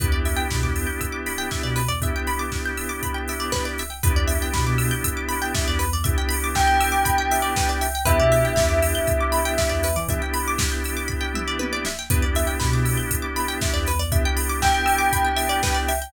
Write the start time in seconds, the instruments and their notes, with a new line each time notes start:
0.00 synth bass 2 E2, drawbar organ B3 D4 E4 G4, pizzicato strings B4, kick, closed hi-hat
0.12 synth bass 2 E2, pizzicato strings D5
0.25 pizzicato strings E5, open hi-hat
0.37 pizzicato strings G5
0.51 synth bass 2 B2, pizzicato strings B5, kick, snare
0.62 synth bass 2 E2, pizzicato strings D6
0.76 pizzicato strings E6, open hi-hat
0.87 pizzicato strings G6
1.01 pizzicato strings E6, kick, closed hi-hat
1.12 pizzicato strings D6
1.26 pizzicato strings B5, open hi-hat
1.38 pizzicato strings G5
1.51 pizzicato strings E5, kick, snare
1.63 synth bass 2 B2, pizzicato strings D5
1.76 pizzicato strings B4, open hi-hat
1.88 synth bass 2 E2, pizzicato strings D5
2.01 drawbar organ B3 D4 E4 G4, pizzicato strings E5, kick, closed hi-hat
2.16 pizzicato strings G5
2.27 pizzicato strings B5, open hi-hat
2.39 pizzicato strings D6
2.52 pizzicato strings E6, kick, snare
2.66 pizzicato strings G6
2.77 pizzicato strings E6, open hi-hat
2.89 pizzicato strings D6
3.03 pizzicato strings B5, kick, closed hi-hat
3.14 pizzicato strings G5
3.28 pizzicato strings E5, open hi-hat
3.40 pizzicato strings D5
3.52 pizzicato strings B4, kick, snare
3.65 pizzicato strings D5
3.78 pizzicato strings E5, open hi-hat
3.90 pizzicato strings G5
4.03 synth bass 2 E2, drawbar organ B3 D4 E4 G4, pizzicato strings B4, kick, closed hi-hat
4.16 synth bass 2 E2, pizzicato strings D5
4.28 pizzicato strings E5, open hi-hat
4.42 pizzicato strings G5
4.54 synth bass 2 B2, pizzicato strings B5, kick, snare
4.67 synth bass 2 B2, pizzicato strings D6
4.78 pizzicato strings E6, open hi-hat
4.91 pizzicato strings G6
5.04 pizzicato strings E6, kick, closed hi-hat
5.17 pizzicato strings D6
5.29 pizzicato strings B5, open hi-hat
5.42 pizzicato strings G5
5.55 pizzicato strings E5, kick, snare
5.68 synth bass 2 E2, pizzicato strings D5
5.79 pizzicato strings B4, open hi-hat
5.92 synth bass 2 E2, pizzicato strings D5
6.04 drawbar organ B3 D4 E4 G4, pizzicato strings E5, kick, closed hi-hat
6.18 pizzicato strings G5
6.29 pizzicato strings B5, open hi-hat
6.44 pizzicato strings D6
6.55 tubular bells G5, pizzicato strings E6, kick, snare
6.67 pizzicato strings G6
6.81 pizzicato strings E6, open hi-hat
6.92 pizzicato strings D6
7.05 pizzicato strings B5, kick, closed hi-hat
7.18 pizzicato strings G5
7.31 pizzicato strings E5, open hi-hat
7.42 pizzicato strings D5
7.56 pizzicato strings B4, kick, snare
7.69 pizzicato strings D5
7.81 pizzicato strings E5, open hi-hat
7.95 pizzicato strings G5
8.05 synth bass 2 E2, drawbar organ B3 D4 E4 G4, pizzicato strings B4, tubular bells E5, kick, closed hi-hat
8.20 synth bass 2 B2, pizzicato strings D5
8.32 pizzicato strings E5, open hi-hat
8.45 pizzicato strings G5
8.56 synth bass 2 E2, pizzicato strings B5, kick, snare
8.69 synth bass 2 E2, pizzicato strings D6
8.82 pizzicato strings E6, open hi-hat
8.95 pizzicato strings G6
9.07 pizzicato strings E6, kick, closed hi-hat
9.20 pizzicato strings D6
9.32 pizzicato strings B5, open hi-hat
9.45 pizzicato strings G5
9.58 pizzicato strings E5, kick, snare
9.69 synth bass 2 E2, pizzicato strings D5
9.83 pizzicato strings B4, open hi-hat
9.96 synth bass 2 E3, pizzicato strings D5
10.08 drawbar organ B3 D4 E4 G4, pizzicato strings E5, kick, closed hi-hat
10.22 pizzicato strings G5
10.34 pizzicato strings B5, open hi-hat
10.48 pizzicato strings D6
10.58 pizzicato strings E6, kick, snare
10.72 pizzicato strings G6
10.84 pizzicato strings E6, open hi-hat
10.97 pizzicato strings D6
11.08 pizzicato strings B5, kick
11.21 pizzicato strings G5
11.34 pizzicato strings E5, mid tom
11.48 pizzicato strings D5
11.59 pizzicato strings B4, high tom
11.73 pizzicato strings D5
11.85 pizzicato strings E5, snare
11.99 pizzicato strings G5
12.10 synth bass 2 E2, drawbar organ B3 D4 E4 G4, pizzicato strings B4, kick, closed hi-hat
12.22 synth bass 2 E2, pizzicato strings D5
12.35 pizzicato strings E5, open hi-hat
12.47 pizzicato strings G5
12.60 synth bass 2 B2, pizzicato strings B5, kick, snare
12.73 synth bass 2 B2, pizzicato strings D6
12.85 pizzicato strings E6, open hi-hat
12.97 pizzicato strings G6
13.11 pizzicato strings E6, kick, closed hi-hat
13.22 pizzicato strings D6
13.36 pizzicato strings B5, open hi-hat
13.48 pizzicato strings G5
13.61 pizzicato strings E5, kick, snare
13.74 synth bass 2 E2, pizzicato strings D5
13.86 pizzicato strings B4, open hi-hat
13.99 synth bass 2 E2, pizzicato strings D5
14.11 drawbar organ B3 D4 E4 G4, pizzicato strings E5, kick, closed hi-hat
14.25 pizzicato strings G5
14.37 pizzicato strings B5, open hi-hat
14.49 pizzicato strings D6
14.62 tubular bells G5, pizzicato strings E6, kick, snare
14.74 pizzicato strings G6
14.86 pizzicato strings E6, open hi-hat
14.98 pizzicato strings D6
15.13 pizzicato strings B5, kick, closed hi-hat
15.25 pizzicato strings G5
15.36 pizzicato strings E5, open hi-hat
15.49 pizzicato strings D5
15.63 pizzicato strings B4, kick, snare
15.74 pizzicato strings D5
15.88 pizzicato strings E5, open hi-hat
16.02 pizzicato strings G5